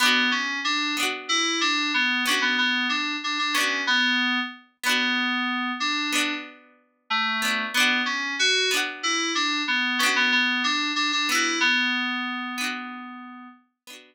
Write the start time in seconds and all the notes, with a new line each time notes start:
0.00 B3 D4
0.06 F#4
0.31 C#4
0.64 D4
0.97 B3 D4
1.03 F#4
1.29 E4
1.61 D4
1.94 B3
2.26 B3 C#4 D4
2.32 F#4
2.42 B3
2.58 B3
2.89 D4
3.24 D4
3.39 D4
3.54 B3 C#4 D4
3.61 F#4
3.87 B3
4.83 B3 D4
4.90 F#4
5.80 D4
6.12 B3 D4
6.18 F#4
7.10 A3
7.42 B3 D4
7.48 F#4
7.74 B3 D4
7.80 F#4
8.06 C#4
8.39 F#4
8.71 B3 D4
8.77 F#4
9.03 E4
9.35 D4
9.68 B3
9.99 B3 C#4
10.03 D4 F#4
10.16 B3
10.32 B3
10.64 D4
10.96 D4
11.12 D4
11.29 B3 D4 E4
11.35 F#4
11.60 B3
12.58 B3 D4
12.64 F#4
13.87 B3 D4
13.93 F#4